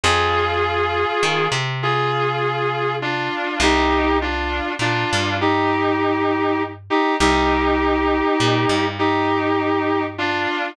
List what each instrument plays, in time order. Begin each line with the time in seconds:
0.03 electric bass (finger) F2, distortion guitar F4 G#4
1.23 electric bass (finger) D#3
1.52 electric bass (finger) C3
1.83 distortion guitar F4 G#4
3.02 distortion guitar D4 F4
3.60 electric bass (finger) C2, distortion guitar D#4 G4
4.22 distortion guitar D4 F4
4.79 electric bass (finger) A#2, distortion guitar D4 F4
5.13 electric bass (finger) G2
5.41 distortion guitar D#4 G4
6.90 distortion guitar D#4 G4
7.20 electric bass (finger) C2, distortion guitar D#4 G4
8.40 electric bass (finger) A#2
8.69 electric bass (finger) G2
8.99 distortion guitar D#4 G4
10.18 distortion guitar D4 F4